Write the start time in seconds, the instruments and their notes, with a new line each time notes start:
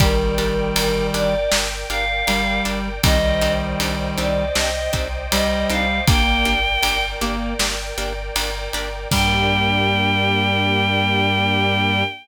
0.00 synth bass 2 G1, clarinet D#3 G3, orchestral harp D4 G4 A#4, choir aahs A#4, string ensemble 1 A#4 D5 G5, kick, ride
0.38 synth bass 2 G1, orchestral harp D4 G4 A#4, ride
0.76 synth bass 2 G1, orchestral harp D4 G4 A#4, choir aahs A#4, ride
1.14 synth bass 2 G1, orchestral harp D4 G4 A#4, choir aahs D5, ride
1.52 synth bass 2 G1, orchestral harp D4 G4 A#4, snare
1.90 synth bass 2 G1, orchestral harp D4 G4 A#4, choir aahs F5, ride
2.27 synth bass 2 G1, clarinet G3, orchestral harp D4 G4 A#4, ride
2.65 synth bass 2 G1, orchestral harp D4 G4 A#4, ride
3.03 synth bass 2 C2, clarinet D#3 G3, orchestral harp C4 D4 D#4 G4, string ensemble 1 C5 D5 D#5 G5, choir aahs D#5, kick, ride
3.41 synth bass 2 C2, orchestral harp C4 D4 D#4 G4, ride
3.80 synth bass 2 C2, orchestral harp C4 D4 D#4 G4, ride
4.18 synth bass 2 C2, orchestral harp C4 D4 D#4 G4, choir aahs D5, ride
4.55 synth bass 2 C2, orchestral harp C4 D4 D#4 G4, choir aahs D#5, snare
4.93 synth bass 2 C2, orchestral harp C4 D4 D#4 G4, kick, ride
5.31 synth bass 2 C2, clarinet G3, orchestral harp C4 D4 D#4 G4, choir aahs D#5, ride
5.69 synth bass 2 C2, orchestral harp C4 D4 D#4 G4, choir aahs F5, ride
6.07 synth bass 2 G1, clarinet A#3, orchestral harp A#3 D4 G4, string ensemble 1 A#4 D5 G5, choir aahs G5, kick, ride
6.45 synth bass 2 G1, orchestral harp A#3 D4 G4, ride
6.83 synth bass 2 G1, orchestral harp A#3 D4 G4, ride
7.21 synth bass 2 G1, clarinet A#3, orchestral harp A#3 D4 G4, ride
7.59 synth bass 2 G1, orchestral harp A#3 D4 G4, snare
7.98 synth bass 2 G1, orchestral harp A#3 D4 G4, ride
8.35 synth bass 2 G1, orchestral harp A#3 D4 G4, ride
8.73 synth bass 2 G1, orchestral harp A#3 D4 G4, ride
9.11 synth bass 2 G2, clarinet G3, string ensemble 1 A#3 D4 G4, orchestral harp D4 G4 A#4, choir aahs G5, kick, crash